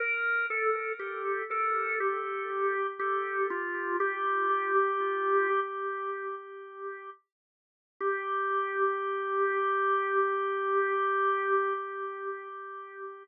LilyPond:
\new Staff { \time 4/4 \key g \minor \tempo 4 = 60 bes'8 a'8 g'8 a'8 g'4 g'8 f'8 | g'2 r2 | g'1 | }